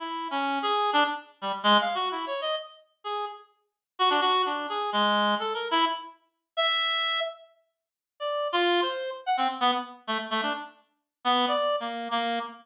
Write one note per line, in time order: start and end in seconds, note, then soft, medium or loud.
0.00 0.28 E4 medium
0.31 0.59 C#4 medium
0.62 0.91 G#4 medium
0.93 1.04 D4 loud
1.42 1.52 G3 medium
1.63 1.78 G#3 loud
1.81 1.95 F5 medium
1.95 2.09 F#4 medium
2.11 2.25 E4 medium
2.27 2.41 C#5 medium
2.41 2.55 D#5 medium
3.04 3.25 G#4 medium
3.99 4.09 F#4 loud
4.10 4.21 D4 medium
4.21 4.42 F#4 loud
4.46 4.67 D4 medium
4.69 4.90 G#4 medium
4.93 5.35 G#3 medium
5.39 5.54 A4 medium
5.54 5.68 A#4 medium
5.71 5.85 E4 loud
6.57 7.20 E5 loud
8.20 8.48 D5 medium
8.53 8.81 F4 loud
8.82 9.10 C5 medium
9.26 9.37 F#5 medium
9.37 9.48 C4 medium
9.61 9.71 B3 loud
10.07 10.18 A3 medium
10.30 10.41 A3 medium
10.42 10.53 D4 medium
11.25 11.46 B3 loud
11.48 11.76 D5 medium
11.80 12.08 A#3 medium
12.11 12.39 A#3 medium